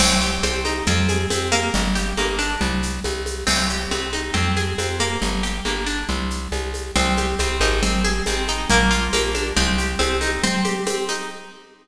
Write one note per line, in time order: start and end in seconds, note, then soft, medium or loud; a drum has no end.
0.00 0.39 C2 medium
0.00 0.43 C4 medium
0.00 crash loud
0.00 low conga loud
0.00 shaker medium
0.21 0.83 G4 medium
0.21 shaker medium
0.43 0.82 C2 medium
0.43 0.85 C4 medium
0.43 high conga medium
0.43 shaker medium
0.65 0.85 D#4 medium
0.65 high conga medium
0.65 shaker medium
0.87 1.26 F2 medium
0.87 1.30 C4 medium
0.87 low conga loud
0.87 shaker medium
1.09 1.71 G#4 medium
1.09 high conga medium
1.09 shaker medium
1.30 1.70 F2 medium
1.30 1.72 C4 medium
1.30 high conga medium
1.30 shaker medium
1.52 2.17 A#3 medium
1.52 high conga medium
1.52 shaker medium
1.74 2.13 G1 medium
1.74 low conga loud
1.74 shaker medium
1.95 2.57 G4 medium
1.95 shaker medium
2.17 2.56 G1 medium
2.17 2.59 A#3 medium
2.17 high conga medium
2.17 shaker medium
2.39 2.59 D4 medium
2.39 shaker medium
2.61 3.00 C2 medium
2.61 low conga loud
2.61 shaker medium
2.83 shaker medium
3.04 3.44 C2 medium
3.04 high conga medium
3.04 shaker medium
3.26 high conga medium
3.26 shaker medium
3.47 3.87 C2 medium
3.47 3.68 C4 medium
3.47 crash loud
3.47 low conga medium
3.47 shaker medium
3.70 3.92 G4 medium
3.70 shaker medium
3.91 4.31 C2 medium
3.91 4.13 C4 medium
3.91 high conga medium
3.91 shaker medium
4.13 4.34 D#4 medium
4.13 high conga medium
4.13 shaker medium
4.34 4.74 F2 medium
4.34 4.56 C4 medium
4.34 low conga medium
4.34 shaker medium
4.57 4.79 G#4 medium
4.57 high conga medium
4.57 shaker medium
4.78 5.17 F2 medium
4.78 5.01 C4 medium
4.78 high conga medium
4.78 shaker medium
5.00 5.43 A#3 medium
5.00 high conga medium
5.00 shaker medium
5.22 5.61 G1 medium
5.22 low conga medium
5.22 shaker medium
5.43 5.65 G4 medium
5.43 shaker medium
5.65 6.04 G1 medium
5.65 5.87 A#3 medium
5.65 high conga medium
5.65 shaker medium
5.87 6.07 D4 medium
5.87 shaker medium
6.09 6.48 C2 medium
6.09 low conga medium
6.09 shaker medium
6.30 shaker medium
6.52 6.91 C2 medium
6.52 high conga medium
6.52 shaker medium
6.74 high conga medium
6.74 shaker medium
6.96 7.35 C2 medium
6.96 7.39 C4 medium
6.96 low conga loud
6.96 shaker medium
7.17 7.80 G4 medium
7.17 high conga medium
7.17 shaker medium
7.39 7.60 C2 medium
7.39 7.81 C4 medium
7.39 high conga medium
7.39 shaker medium
7.60 8.21 G#1 medium
7.60 7.81 D#4 medium
7.60 high conga medium
7.60 shaker medium
7.83 8.26 C4 medium
7.83 low conga loud
7.83 shaker medium
8.04 8.66 G#4 medium
8.04 high conga medium
8.04 shaker medium
8.26 8.66 G#1 medium
8.26 8.68 C4 medium
8.26 high conga medium
8.26 shaker medium
8.48 8.69 D#4 medium
8.48 shaker medium
8.70 9.09 A#1 medium
8.70 9.12 A#3 medium
8.70 low conga loud
8.70 shaker medium
8.91 9.53 F4 medium
8.91 shaker medium
9.13 9.52 A#1 medium
9.13 9.54 A#3 medium
9.13 high conga medium
9.13 shaker medium
9.35 9.55 D4 medium
9.35 high conga medium
9.35 shaker medium
9.56 9.96 C2 medium
9.56 9.99 C4 medium
9.56 low conga loud
9.56 shaker medium
9.78 10.40 G4 medium
9.78 shaker medium
9.99 10.39 C2 medium
9.99 10.40 C4 medium
9.99 high conga medium
9.99 shaker medium
10.21 10.41 D#4 medium
10.21 high conga medium
10.21 shaker medium
10.43 10.86 C4 medium
10.43 low conga loud
10.43 shaker medium
10.65 11.27 G4 medium
10.65 high conga medium
10.65 shaker medium
10.87 11.28 C4 medium
10.87 high conga loud
10.87 shaker medium
11.09 11.29 D#4 medium
11.09 shaker medium